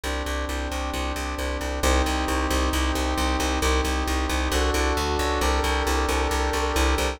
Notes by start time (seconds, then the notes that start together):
0.03 C2 C4 D4 G4
0.26 C2
0.49 C2
0.71 C2
0.93 C2
1.16 C2
1.38 C2
1.61 C2
1.83 C2 C4 D#4 G4
2.06 C2
2.28 C2
2.50 C2
2.73 C2
2.95 C2
3.18 C2
3.40 C2
3.62 C2 C4 D#4 G4
3.85 C2
4.07 C2
4.29 C2
4.52 C2 D4 F#4 A4
4.74 C2
4.97 D2
5.19 C#2
5.41 C2 D4 G4 A4 A#4
5.64 C2
5.87 C2
6.09 C2
6.31 C2
6.53 C2
6.76 C2
6.98 C2